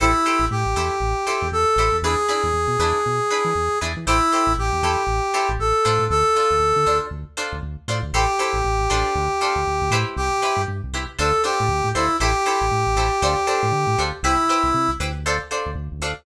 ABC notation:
X:1
M:4/4
L:1/16
Q:"Swing 16ths" 1/4=118
K:Am
V:1 name="Brass Section"
E4 G8 A4 | ^G16 | E4 G8 A4 | A8 z8 |
G16 | G4 z4 A2 G4 E2 | G16 | E6 z10 |]
V:2 name="Pizzicato Strings"
[EGAc]2 [EGAc]4 [EGAc]4 [EGAc]4 [EGAc]2 | [DE^GB]2 [DEGB]4 [DEGB]4 [DEGB]4 [DEGB]2 | [EGAc]2 [EGAc]4 [EGAc]4 [EGAc]4 [DFAc]2- | [DFAc]2 [DFAc]4 [DFAc]4 [DFAc]4 [DFAc]2 |
[EGAc]2 [EGAc]4 [DFAc]4 [DFAc]4 [EGBc]2- | [EGBc]2 [EGBc]4 [EGBc]2 [DFAc]2 [DFAc]4 [DFAc]2 | [EGAc]2 [EGAc]4 [EGAc]2 [DFAc]2 [DFAc]4 [DFAc]2 | [EGBc]2 [EGBc]4 [EGBc]2 [DFAc]2 [DFAc]4 [DFAc]2 |]
V:3 name="Synth Bass 1" clef=bass
A,,,3 A,,, A,, A,,, E,,2 A,,,3 E,, E,,2 A,,, E,, | E,,3 E,, E,, B,, E,,2 B,,3 E, E,,2 E,, E, | A,,,3 A,,, A,,, E,, E,,2 A,,,3 A,,, A,,,2 A,, A,, | D,,3 D,, D,, D, D,,2 D,,3 D,, D,,2 A,, D,, |
A,,,3 A,,, A,,, A,,, A,,,2 D,,3 D,, D,, D,, A,,2 | C,,3 G,, G,, C,, C,,2 D,,3 A,, D,, A,, D,,2 | A,,,3 A,,, A,, A,,, A,,,2 D,,3 A,, D, A,, D,,2 | C,,3 C,, C, C,, D,,5 D,, D,, D,, D,,2 |]